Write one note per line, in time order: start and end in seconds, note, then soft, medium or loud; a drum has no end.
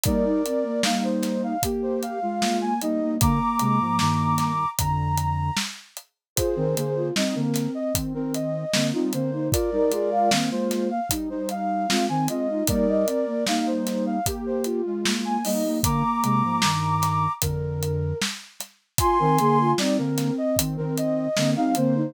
0.03 0.41 G3 medium
0.03 0.25 A#3 loud
0.03 0.41 D#4 medium
0.03 0.82 A#4 medium
0.03 0.82 D5 medium
0.03 kick loud
0.03 closed hi-hat loud
0.25 0.43 D#4 loud
0.46 0.64 C4 medium
0.46 closed hi-hat medium
0.63 0.82 A#3 medium
0.83 1.56 G3 medium
0.83 1.53 A#3 loud
0.83 1.56 D#4 medium
0.83 1.03 F5 medium
0.83 snare loud
1.04 1.42 C5 medium
1.23 snare medium
1.23 closed hi-hat medium
1.43 1.62 F5 medium
1.63 2.19 A#3 medium
1.63 2.19 G4 medium
1.63 kick medium
1.63 closed hi-hat loud
1.82 2.01 C5 medium
2.02 2.57 F5 medium
2.02 closed hi-hat medium
2.22 2.73 G#3 medium
2.22 2.73 F4 medium
2.40 2.59 A#3 medium
2.40 snare loud
2.61 2.80 A#3 loud
2.61 2.80 G#5 medium
2.81 3.16 G3 medium
2.81 3.00 A#3 loud
2.81 3.16 D#4 medium
2.81 3.14 D#5 medium
2.81 closed hi-hat medium
3.01 3.19 A#3 loud
3.21 3.39 D3 medium
3.21 3.39 A#3 medium
3.21 4.52 A#3 loud
3.21 4.69 A#5 medium
3.21 4.69 D6 medium
3.21 kick loud
3.21 closed hi-hat loud
3.59 3.79 C3 medium
3.59 3.79 G#3 medium
3.59 closed hi-hat medium
3.80 3.99 G#2 medium
3.80 3.99 F3 medium
3.99 4.64 G2 medium
3.99 4.64 D#3 medium
3.99 snare loud
4.38 snare medium
4.38 closed hi-hat medium
4.79 5.50 F2 medium
4.79 5.50 D3 medium
4.79 5.55 A#5 medium
4.79 kick medium
4.79 closed hi-hat loud
5.17 closed hi-hat medium
5.57 snare loud
5.97 closed hi-hat medium
6.36 6.55 F4 loud
6.36 7.08 G#4 medium
6.36 7.08 C5 medium
6.36 kick loud
6.36 closed hi-hat loud
6.56 6.75 D#3 medium
6.56 6.75 C4 medium
6.56 6.75 A#4 medium
6.75 7.10 D3 medium
6.75 7.10 A#3 medium
6.75 6.94 G#4 loud
6.75 closed hi-hat medium
6.95 7.14 F4 medium
7.16 7.34 G3 medium
7.16 7.92 C4 loud
7.16 7.34 D#4 medium
7.16 7.35 D#5 medium
7.16 snare loud
7.35 7.67 D3 medium
7.35 7.67 A#3 medium
7.35 7.71 A#4 medium
7.54 snare medium
7.54 closed hi-hat medium
7.75 7.93 D#5 medium
7.94 8.13 D#3 medium
7.94 8.13 C4 medium
7.94 kick medium
7.94 closed hi-hat loud
8.14 8.64 D#3 medium
8.14 8.64 C4 medium
8.14 8.33 A#4 medium
8.34 8.86 D#5 medium
8.34 closed hi-hat medium
8.73 8.92 D3 medium
8.73 8.92 A#3 medium
8.73 8.92 C4 medium
8.73 snare loud
8.93 9.12 G3 medium
8.93 9.12 C4 loud
8.93 9.12 D#4 medium
8.93 9.12 F4 medium
9.12 9.49 D3 medium
9.12 9.49 A#3 medium
9.12 9.31 C4 loud
9.12 9.47 C5 medium
9.12 closed hi-hat medium
9.32 9.51 D#4 loud
9.51 9.70 F4 loud
9.51 10.29 A#4 medium
9.51 10.29 D5 medium
9.51 kick loud
9.51 closed hi-hat loud
9.72 9.91 G3 medium
9.72 9.91 D#4 medium
9.72 9.92 A#4 loud
9.91 10.30 G#3 medium
9.91 10.30 F4 medium
9.91 10.10 G#4 loud
9.91 closed hi-hat medium
10.12 10.30 F5 loud
10.31 10.50 D#3 medium
10.31 11.00 A#3 loud
10.31 10.50 C4 medium
10.31 10.50 F5 medium
10.31 snare loud
10.51 10.90 G#3 medium
10.51 10.90 F4 medium
10.51 10.88 C5 medium
10.71 snare medium
10.71 closed hi-hat medium
10.90 11.09 F5 medium
11.10 11.29 G3 medium
11.10 11.29 D#4 medium
11.10 kick medium
11.10 closed hi-hat loud
11.30 11.86 G3 medium
11.30 11.86 D#4 medium
11.30 11.49 C5 medium
11.49 12.06 F5 medium
11.49 closed hi-hat medium
11.88 12.08 G#3 medium
11.88 12.07 C4 loud
11.88 12.08 F4 medium
11.88 snare loud
12.08 12.28 D#3 medium
12.08 12.27 C4 medium
12.08 12.28 C4 medium
12.08 12.28 G#5 medium
12.28 12.62 G#3 medium
12.28 12.48 C4 loud
12.28 12.62 F4 medium
12.28 12.64 D#5 medium
12.28 closed hi-hat medium
12.50 12.68 D#4 loud
12.67 13.05 G3 medium
12.67 12.87 A#3 loud
12.67 13.05 D#4 medium
12.67 13.44 A#4 medium
12.67 13.44 D5 medium
12.67 kick loud
12.67 closed hi-hat loud
12.88 13.07 D#5 loud
13.06 13.25 C4 medium
13.06 closed hi-hat medium
13.26 13.45 A#3 medium
13.47 14.19 G3 medium
13.47 14.17 A#3 loud
13.47 14.19 D#4 medium
13.47 13.66 F5 medium
13.47 snare loud
13.66 14.05 C5 medium
13.87 snare medium
13.87 closed hi-hat medium
14.06 14.25 F5 medium
14.26 14.81 A#3 medium
14.26 14.81 G4 medium
14.26 kick medium
14.26 closed hi-hat medium
14.46 14.65 C5 medium
14.64 15.20 F4 medium
14.64 closed hi-hat medium
14.85 15.37 G#3 medium
14.85 15.37 F4 medium
15.05 15.24 A#3 medium
15.05 snare loud
15.24 15.43 A#3 loud
15.24 15.44 G#5 medium
15.45 15.80 G3 medium
15.45 15.64 A#3 loud
15.45 15.80 D#4 medium
15.45 15.77 D#5 medium
15.45 open hi-hat medium
15.65 15.82 A#3 loud
15.83 16.03 D3 medium
15.83 16.62 A#3 loud
15.83 16.03 A#3 medium
15.83 17.32 A#5 medium
15.83 17.32 D6 medium
15.83 kick loud
15.83 closed hi-hat loud
16.23 16.42 C3 medium
16.23 16.42 G#3 medium
16.23 closed hi-hat medium
16.44 16.62 G#2 medium
16.44 16.62 F3 medium
16.62 17.27 G2 medium
16.62 17.27 D#3 medium
16.62 snare loud
17.02 snare medium
17.02 closed hi-hat medium
17.42 18.13 F2 medium
17.42 18.13 D3 medium
17.42 18.18 A#4 medium
17.42 kick medium
17.42 closed hi-hat loud
17.83 closed hi-hat medium
18.22 snare loud
18.60 snare soft
18.60 closed hi-hat medium
18.98 19.18 F4 loud
18.98 19.72 G#5 medium
18.98 19.72 C6 loud
18.98 kick loud
18.98 closed hi-hat loud
19.19 19.38 D#3 medium
19.19 19.38 C4 loud
19.19 19.38 A#4 loud
19.38 19.73 D3 medium
19.38 19.73 A#3 medium
19.38 19.58 G#4 loud
19.38 closed hi-hat medium
19.60 19.79 F4 loud
19.78 19.97 G3 medium
19.78 20.56 C4 loud
19.78 19.97 D#4 medium
19.78 19.97 D5 medium
19.78 snare loud
19.98 20.30 D3 medium
19.98 20.30 A#3 medium
19.98 20.34 A#4 medium
20.18 snare medium
20.18 closed hi-hat medium
20.38 20.57 D#5 medium
20.56 20.77 D#3 medium
20.56 20.77 C4 medium
20.56 kick medium
20.56 closed hi-hat loud
20.77 21.27 D#3 medium
20.77 21.27 C4 medium
20.77 20.96 A#4 medium
20.97 21.50 D#5 medium
20.97 closed hi-hat medium
21.37 21.55 D3 medium
21.37 21.55 A#3 medium
21.37 21.55 C4 loud
21.37 snare loud
21.56 21.75 G3 medium
21.56 21.75 C4 loud
21.56 21.75 D#4 medium
21.56 21.75 F5 medium
21.75 22.12 D3 medium
21.75 22.12 A#3 medium
21.75 21.95 C4 loud
21.75 22.10 C5 loud
21.75 closed hi-hat medium
21.95 22.14 D#4 loud